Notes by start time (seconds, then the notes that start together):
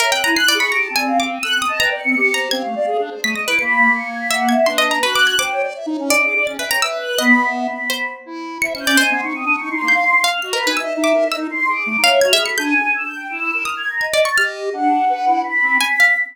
0.00 A#4 C#5 E5
0.11 C4 G5 F#6
0.24 E4 G#5 A#5
0.35 E4 F#6 C7
0.48 D5
0.54 G#4 C#6
0.60 B5
0.71 G4 A#5 D7
0.83 A5
0.90 C4
0.95 D5 G#5
1.07 F5
1.20 F5 D6
1.33 D#7
1.43 A4 E6 F#6
1.55 C4 D#6
1.62 D#6
1.67 D#5 A5
1.79 B4 G5 A#5
1.90 D5
1.97 C#7
2.04 C4
2.16 G4
2.34 C5 A#5
2.51 C4 F5 G#6
2.64 A3
2.75 D5
2.86 G#4
2.99 D4
3.10 C5
3.24 A3 D#6 B6
3.34 D#5 A#6
3.42 D7
3.47 E4 B4
3.59 A#3 B5 C#7
3.95 C#7
4.06 G#6
4.20 B6
4.31 E5 F#5
4.49 E5 G#6
4.66 D4 B4 C6
4.78 D#5
4.91 A#5
5.03 F#4 B4 F#6
5.15 D6
5.27 G#6
5.38 C5 G5 D6
5.51 C#5
5.63 D5
5.75 E5
5.86 D#4
5.91 C#5
5.99 C#4
6.09 D5 D#5 D6
6.24 G#4
6.36 D5
6.46 C#4 A6
6.59 B4 E5
6.63 G5
6.70 C#5 A#5
6.82 B4 E5 E6
7.01 F#6
7.18 B3 D#5 B5
7.44 E5
7.66 B5
7.90 C5 B5
8.26 E4
8.62 C5 E5 C#7
8.74 C#4 C#7
8.80 G6
8.87 C#4 D5
8.97 C5 D#5 G#5
9.10 B3 C6
9.23 D#4 C#6
9.34 C4 D#6
9.45 D4
9.53 C#6
9.58 D#4
9.70 D#4 C6
9.82 A#3
9.88 G6
9.94 F5
10.24 F5 F6
10.42 F#4 D#5 C7
10.53 A#4 B4 B5
10.65 D#4 B4 G#5
10.77 D#5 E5 E6
10.97 D#4
11.04 D6
11.13 A#4
11.25 D#5
11.32 E6
11.37 D#4
11.50 C6
11.68 G#4 D6
11.86 A3
11.98 D#4
12.02 C#5 F5
12.10 E5
12.21 F#4 F6 G#6
12.33 G#4 E5
12.39 B5
12.46 A4 C#7
12.58 D4 G#5 G6
12.94 E6
13.05 G6
13.16 G5
13.29 E4 E6
13.40 E4
13.53 A#4
13.65 D#6 F6
13.77 G#6
13.89 A#5
14.01 D#5 G#6
14.13 D5
14.21 A6
14.25 C#6
14.37 G4 D#5 F6
14.73 D4 F#5
15.09 B4
15.26 E4
15.44 B5
15.62 C4
15.81 G#5 B6
16.00 F5